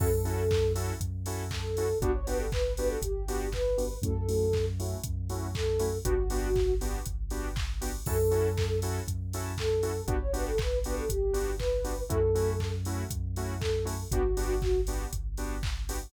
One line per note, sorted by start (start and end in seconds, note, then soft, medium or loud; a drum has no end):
0.00 0.92 F#2 loud
0.00 0.08 C#4 loud
0.00 0.08 E4 loud
0.00 0.08 F#4 loud
0.00 0.08 A4 loud
0.00 0.72 A4 loud
0.00 kick loud
0.00 crash loud
0.25 0.43 C#4 loud
0.25 0.43 E4 medium
0.25 0.43 F#4 loud
0.25 0.43 A4 medium
0.25 open hi-hat medium
0.51 kick loud
0.51 clap loud
0.75 0.93 C#4 medium
0.75 0.93 E4 medium
0.75 0.93 F#4 loud
0.75 0.93 A4 loud
0.75 open hi-hat medium
1.00 1.93 F#2 medium
1.00 kick medium
1.00 closed hi-hat loud
1.26 1.44 C#4 loud
1.26 1.44 E4 loud
1.26 1.44 F#4 medium
1.26 1.44 A4 medium
1.26 open hi-hat medium
1.51 1.98 A4 loud
1.51 kick medium
1.51 clap loud
1.77 1.86 C#4 medium
1.77 1.86 E4 medium
1.77 1.86 F#4 loud
1.77 1.86 A4 medium
1.77 open hi-hat medium
2.00 2.93 G1 medium
2.00 2.11 B3 loud
2.00 2.11 D4 loud
2.00 2.12 F#4 loud
2.00 2.11 F#4 loud
2.00 2.11 G4 loud
2.00 kick loud
2.00 closed hi-hat loud
2.14 2.26 C#5 loud
2.26 2.45 B3 medium
2.26 2.45 D4 loud
2.26 2.45 F#4 loud
2.26 2.45 G4 loud
2.26 2.38 B4 medium
2.26 open hi-hat medium
2.39 2.51 A4 loud
2.52 2.73 B4 medium
2.52 kick loud
2.52 clap loud
2.76 2.96 B3 loud
2.76 2.96 D4 medium
2.76 2.96 F#4 loud
2.76 2.96 G4 loud
2.76 2.88 B4 loud
2.76 open hi-hat medium
2.88 3.00 A4 medium
3.02 3.95 G1 medium
3.02 3.49 G4 medium
3.02 kick medium
3.02 closed hi-hat loud
3.28 3.46 B3 medium
3.28 3.46 D4 medium
3.28 3.46 F#4 loud
3.28 3.46 G4 loud
3.28 open hi-hat medium
3.52 3.97 B4 medium
3.52 kick medium
3.52 clap loud
3.78 3.86 B3 loud
3.78 3.86 D4 medium
3.78 3.86 F#4 medium
3.78 3.86 G4 medium
3.78 open hi-hat medium
4.02 4.95 F#2 loud
4.02 4.12 A3 loud
4.02 4.12 C#4 loud
4.02 4.12 E4 loud
4.02 4.12 F#4 loud
4.02 4.65 A4 loud
4.02 kick loud
4.02 closed hi-hat loud
4.28 4.46 A3 loud
4.28 4.46 C#4 loud
4.28 4.46 E4 loud
4.28 4.46 F#4 medium
4.28 open hi-hat medium
4.53 kick medium
4.53 clap loud
4.79 4.97 A3 loud
4.79 4.97 C#4 medium
4.79 4.97 E4 loud
4.79 4.97 F#4 loud
4.79 open hi-hat medium
5.03 5.99 F#2 medium
5.03 kick loud
5.03 closed hi-hat loud
5.30 5.47 A3 medium
5.30 5.47 C#4 loud
5.30 5.47 E4 loud
5.30 5.47 F#4 loud
5.30 open hi-hat medium
5.55 5.98 A4 medium
5.55 kick loud
5.55 clap loud
5.79 5.88 A3 loud
5.79 5.88 C#4 loud
5.79 5.88 E4 loud
5.79 5.88 F#4 medium
5.79 open hi-hat medium
6.05 6.99 G1 loud
6.05 6.14 B3 loud
6.05 6.14 D4 loud
6.05 6.14 F#4 loud
6.05 6.75 F#4 loud
6.05 6.14 G4 loud
6.05 kick loud
6.05 closed hi-hat loud
6.30 6.48 B3 loud
6.30 6.48 D4 loud
6.30 6.48 F#4 loud
6.30 6.48 G4 medium
6.30 open hi-hat medium
6.56 kick loud
6.56 clap medium
6.81 6.99 B3 loud
6.81 6.99 D4 medium
6.81 6.99 F#4 medium
6.81 6.99 G4 medium
6.81 open hi-hat medium
7.06 7.99 G1 medium
7.06 kick medium
7.06 closed hi-hat loud
7.30 7.48 B3 loud
7.30 7.48 D4 loud
7.30 7.48 F#4 medium
7.30 7.48 G4 loud
7.30 open hi-hat medium
7.56 kick loud
7.56 clap loud
7.81 7.90 B3 loud
7.81 7.90 D4 medium
7.81 7.90 F#4 loud
7.81 7.90 G4 loud
7.81 open hi-hat loud
8.06 9.00 F#2 loud
8.06 8.16 C#4 loud
8.06 8.16 E4 loud
8.06 8.16 F#4 loud
8.06 8.16 A4 loud
8.06 8.79 A4 loud
8.06 kick loud
8.06 crash loud
8.31 8.49 C#4 loud
8.31 8.49 E4 medium
8.31 8.49 F#4 loud
8.31 8.49 A4 medium
8.31 open hi-hat medium
8.57 kick loud
8.57 clap loud
8.82 9.00 C#4 medium
8.82 9.00 E4 medium
8.82 9.00 F#4 loud
8.82 9.00 A4 loud
8.82 open hi-hat medium
9.08 10.01 F#2 medium
9.08 kick medium
9.08 closed hi-hat loud
9.33 9.52 C#4 loud
9.33 9.52 E4 loud
9.33 9.52 F#4 medium
9.33 9.52 A4 medium
9.33 open hi-hat medium
9.58 10.05 A4 loud
9.58 kick medium
9.58 clap loud
9.83 9.91 C#4 medium
9.83 9.91 E4 medium
9.83 9.91 F#4 loud
9.83 9.91 A4 medium
9.83 open hi-hat medium
10.07 11.00 G1 medium
10.07 10.16 B3 loud
10.07 10.16 D4 loud
10.07 10.16 F#4 loud
10.07 10.20 F#4 loud
10.07 10.16 G4 loud
10.07 kick loud
10.07 closed hi-hat loud
10.20 10.32 C#5 loud
10.33 10.51 B3 medium
10.33 10.51 D4 loud
10.33 10.51 F#4 loud
10.33 10.51 G4 loud
10.33 10.45 B4 medium
10.33 open hi-hat medium
10.47 10.59 A4 loud
10.58 10.79 B4 medium
10.58 kick loud
10.58 clap loud
10.83 11.03 B3 loud
10.83 11.03 D4 medium
10.83 11.03 F#4 loud
10.83 11.03 G4 loud
10.83 10.95 B4 loud
10.83 open hi-hat medium
10.97 11.09 A4 medium
11.09 12.03 G1 medium
11.09 11.55 G4 medium
11.09 kick medium
11.09 closed hi-hat loud
11.33 11.51 B3 medium
11.33 11.51 D4 medium
11.33 11.51 F#4 loud
11.33 11.51 G4 loud
11.33 open hi-hat medium
11.59 12.03 B4 medium
11.59 kick medium
11.59 clap loud
11.84 11.93 B3 loud
11.84 11.93 D4 medium
11.84 11.93 F#4 medium
11.84 11.93 G4 medium
11.84 open hi-hat medium
12.09 13.04 F#2 loud
12.09 12.18 A3 loud
12.09 12.18 C#4 loud
12.09 12.18 E4 loud
12.09 12.18 F#4 loud
12.09 12.72 A4 loud
12.09 kick loud
12.09 closed hi-hat loud
12.35 12.52 A3 loud
12.35 12.52 C#4 loud
12.35 12.52 E4 loud
12.35 12.52 F#4 medium
12.35 open hi-hat medium
12.60 kick medium
12.60 clap loud
12.85 13.03 A3 loud
12.85 13.03 C#4 medium
12.85 13.03 E4 loud
12.85 13.03 F#4 loud
12.85 open hi-hat medium
13.10 14.04 F#2 medium
13.10 kick loud
13.10 closed hi-hat loud
13.36 13.54 A3 medium
13.36 13.54 C#4 loud
13.36 13.54 E4 loud
13.36 13.54 F#4 loud
13.36 open hi-hat medium
13.60 14.03 A4 medium
13.60 kick loud
13.60 clap loud
13.85 13.94 A3 loud
13.85 13.94 C#4 loud
13.85 13.94 E4 loud
13.85 13.94 F#4 medium
13.85 open hi-hat medium
14.11 15.04 G1 loud
14.11 14.21 B3 loud
14.11 14.21 D4 loud
14.11 14.81 F#4 loud
14.11 14.21 F#4 loud
14.11 14.21 G4 loud
14.11 kick loud
14.11 closed hi-hat loud
14.37 14.54 B3 loud
14.37 14.54 D4 loud
14.37 14.54 F#4 loud
14.37 14.54 G4 medium
14.37 open hi-hat medium
14.62 kick loud
14.62 clap medium
14.87 15.05 B3 loud
14.87 15.05 D4 medium
14.87 15.05 F#4 medium
14.87 15.05 G4 medium
14.87 open hi-hat medium
15.13 16.05 G1 medium
15.13 kick medium
15.13 closed hi-hat loud
15.37 15.55 B3 loud
15.37 15.55 D4 loud
15.37 15.55 F#4 medium
15.37 15.55 G4 loud
15.37 open hi-hat medium
15.63 kick loud
15.63 clap loud
15.89 15.98 B3 loud
15.89 15.98 D4 medium
15.89 15.98 F#4 loud
15.89 15.98 G4 loud
15.89 open hi-hat loud